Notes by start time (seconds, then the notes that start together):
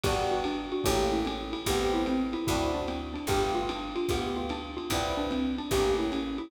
0.03 G1 B3 D4 F#4 G4, kick, crash, ride
0.31 F#4
0.44 D4, hi-hat pedal, ride
0.72 F#4, ride
0.84 A1 A3 A#3 C#4 G4, kick, ride
1.12 E4
1.25 C#4, hi-hat pedal, ride
1.53 E4, ride
1.66 A1 A3 B3 C4 G4, kick, ride
1.94 E4
2.06 C4, hi-hat pedal, ride
2.33 E4, ride
2.47 D2 C4 D4 E4 F#4, kick, ride
2.74 D4
2.88 C4, hi-hat pedal, ride
3.14 D4, ride
3.27 G1 A3 B3 F4 G4, kick, ride
3.55 F4
3.69 D4, hi-hat pedal, ride
3.96 F4, ride
4.09 D2 A3 B3 F4 G4, kick, ride
4.36 F4
4.49 D4, hi-hat pedal, ride
4.77 F4, ride
4.90 C2 B3 C4 D4 E4, kick, ride
5.17 D4
5.31 C4, hi-hat pedal, ride
5.58 D4, ride
5.71 A1 A3 A#3 C#4 G4, kick, ride
5.98 E4
6.12 C#4, hi-hat pedal, ride
6.38 E4, ride